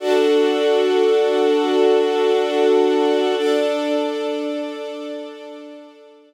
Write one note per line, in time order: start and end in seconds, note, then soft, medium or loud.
0.00 3.35 D4 medium
0.00 3.35 F#4 medium
0.00 3.35 A4 medium
3.37 6.34 D4 medium
3.37 6.34 A4 medium
3.37 6.34 D5 medium